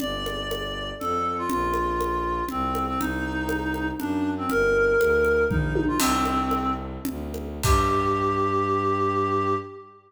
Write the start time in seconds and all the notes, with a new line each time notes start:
0.00 G1 D5, low conga
0.26 high conga
0.51 high conga
1.00 F2 A4, low conga
1.38 F4
1.49 A#1 F4, low conga
1.74 high conga
2.01 high conga
2.49 C2 C4, low conga
2.75 high conga
2.87 C4
3.00 C2 D#4, low conga
3.49 high conga
3.74 high conga
4.00 F#2 D4, low conga
4.38 C4
4.50 G1 A#4, low conga
4.99 D2, high conga
5.25 high conga
5.49 A#1 D#4, kick, floor tom
5.75 high tom
5.88 F4
5.99 C2 C4, crash, low conga
6.25 high conga
6.51 high conga
7.05 D2, low conga
7.34 high conga
7.63 G2 G4, kick, crash